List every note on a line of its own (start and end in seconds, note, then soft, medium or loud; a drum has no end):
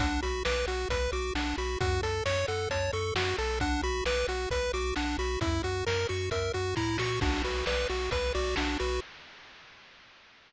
0.00 0.19 B1 loud
0.00 0.21 D4 loud
0.00 0.20 F#5 medium
0.00 kick loud
0.00 closed hi-hat loud
0.23 0.43 B1 medium
0.23 0.43 F#4 medium
0.23 0.43 B5 medium
0.23 closed hi-hat medium
0.45 0.65 B1 loud
0.45 0.66 B4 loud
0.45 0.65 D6 medium
0.45 snare loud
0.67 0.86 B1 medium
0.67 0.88 F#4 medium
0.67 0.88 F#5 medium
0.67 closed hi-hat medium
0.89 1.08 B1 loud
0.89 1.11 B4 medium
0.89 1.11 B5 medium
0.89 kick medium
0.89 closed hi-hat loud
1.12 1.31 B1 loud
1.12 1.34 F#4 medium
1.12 1.33 D6 medium
1.12 closed hi-hat medium
1.35 1.54 B1 loud
1.35 1.56 D4 medium
1.35 1.56 F#5 medium
1.35 snare loud
1.58 1.77 B1 loud
1.58 1.79 F#4 medium
1.58 1.78 B5 medium
1.58 closed hi-hat medium
1.80 2.00 F#2 loud
1.80 2.01 F#4 loud
1.80 2.01 F#5 medium
1.80 kick loud
1.80 closed hi-hat medium
2.02 2.22 F#2 medium
2.02 2.24 A4 medium
2.02 2.23 A5 medium
2.02 closed hi-hat medium
2.25 2.45 F#2 loud
2.25 2.46 C#5 loud
2.25 2.46 C#6 medium
2.25 snare loud
2.48 2.68 F#2 medium
2.48 2.69 A4 medium
2.48 2.68 F#5 medium
2.48 closed hi-hat medium
2.70 2.90 F#2 loud
2.70 2.91 C#5 medium
2.70 2.91 A5 medium
2.70 kick medium
2.70 closed hi-hat loud
2.93 3.12 F#2 medium
2.93 3.14 A4 medium
2.93 3.13 C#6 medium
2.93 closed hi-hat medium
3.15 3.34 F#2 medium
3.15 3.37 F#4 medium
3.15 3.36 F#5 medium
3.15 snare loud
3.37 3.80 B1 loud
3.37 3.59 A4 medium
3.37 3.59 A5 medium
3.37 open hi-hat medium
3.60 3.82 D4 loud
3.60 3.81 F#5 medium
3.60 kick loud
3.60 closed hi-hat medium
3.82 4.02 B1 loud
3.82 4.04 F#4 medium
3.82 4.04 B5 medium
3.82 closed hi-hat medium
4.05 4.25 B1 medium
4.05 4.27 B4 loud
4.05 4.26 D6 medium
4.05 snare loud
4.28 4.47 B1 medium
4.28 4.49 F#4 medium
4.28 4.49 F#5 medium
4.28 closed hi-hat medium
4.50 4.70 B1 medium
4.50 4.72 B4 loud
4.50 4.71 B5 medium
4.50 kick medium
4.50 closed hi-hat medium
4.73 4.93 B1 loud
4.73 4.94 F#4 medium
4.73 4.94 D6 medium
4.73 closed hi-hat medium
4.96 5.16 B1 medium
4.96 5.17 D4 loud
4.96 5.17 F#5 medium
4.96 snare medium
5.18 5.37 B1 loud
5.18 5.39 F#4 medium
5.18 5.39 B5 medium
5.18 closed hi-hat medium
5.41 5.60 F#2 loud
5.41 5.62 E4 loud
5.41 5.62 E5 medium
5.41 kick loud
5.41 closed hi-hat loud
5.63 5.83 F#2 medium
5.63 5.85 F#4 medium
5.63 5.84 F#5 medium
5.63 closed hi-hat medium
5.86 6.06 F#2 loud
5.86 6.07 A#4 loud
5.86 6.07 A#5 medium
5.86 snare loud
6.09 6.29 F#2 loud
6.09 6.30 F#4 medium
6.09 6.29 C#6 medium
6.09 closed hi-hat medium
6.31 6.50 F#2 medium
6.31 6.52 A#4 medium
6.31 6.52 E5 medium
6.31 kick medium
6.31 closed hi-hat medium
6.53 6.74 F#2 medium
6.53 6.75 F#4 medium
6.53 6.75 F#5 medium
6.53 closed hi-hat medium
6.76 6.98 A2 medium
6.76 6.97 E4 loud
6.76 6.97 A#5 medium
6.76 kick medium
6.76 snare medium
6.98 7.19 A#2 medium
6.98 7.20 F#4 medium
6.98 7.19 C#6 medium
6.98 snare loud
7.21 7.42 B1 loud
7.21 7.43 D4 medium
7.21 7.42 F#4 medium
7.21 kick loud
7.21 crash loud
7.44 7.63 B1 medium
7.44 7.65 F#4 medium
7.44 7.65 B4 medium
7.44 closed hi-hat medium
7.66 7.86 B1 medium
7.66 7.88 B4 loud
7.66 7.87 D5 medium
7.66 snare loud
7.89 8.09 B1 medium
7.89 8.10 F#4 medium
7.89 closed hi-hat medium
8.11 8.31 B1 medium
8.11 8.33 B4 medium
8.11 8.32 B4 medium
8.11 kick medium
8.11 closed hi-hat loud
8.35 8.55 B1 loud
8.35 8.55 F#4 loud
8.35 8.55 D5 medium
8.35 closed hi-hat medium
8.56 8.77 B1 loud
8.56 8.78 D4 medium
8.56 8.77 F#4 medium
8.56 snare loud
8.79 9.00 B1 loud
8.79 9.00 F#4 loud
8.79 9.00 B4 medium
8.79 closed hi-hat medium